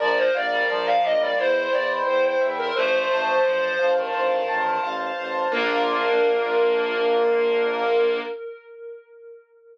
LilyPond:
<<
  \new Staff \with { instrumentName = "Flute" } { \time 4/4 \key bes \major \tempo 4 = 87 d''16 c''16 d''8 d''16 f''16 ees''16 d''16 c''8 d''16 r16 c''16 c''16 r16 bes'16 | c''2 r2 | bes'1 | }
  \new Staff \with { instrumentName = "Clarinet" } { \time 4/4 \key bes \major f8 r16 g16 f8. g16 e'2 | <f a>4 f8 f16 ees4~ ees16 r4 | bes1 | }
  \new Staff \with { instrumentName = "Acoustic Grand Piano" } { \time 4/4 \key bes \major bes'8 f''8 bes'8 d''8 c''8 g''8 c''8 e''8 | c''8 a''8 c''8 f''8 c''8 a''8 f''8 c''8 | <bes d' f'>1 | }
  \new Staff \with { instrumentName = "Violin" } { \clef bass \time 4/4 \key bes \major bes,,8 bes,,8 bes,,8 bes,,8 e,8 e,8 e,8 e,8 | a,,8 a,,8 a,,8 a,,8 a,,8 a,,8 a,,8 a,,8 | bes,,1 | }
>>